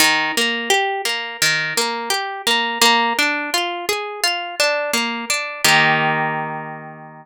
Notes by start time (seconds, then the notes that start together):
0.00 D#3
0.37 A#3
0.70 G4
1.05 A#3
1.42 D#3
1.77 A#3
2.10 G4
2.47 A#3
2.81 A#3
3.19 D4
3.54 F4
3.89 G#4
4.24 F4
4.60 D4
4.93 A#3
5.30 D4
5.64 D#3 A#3 G4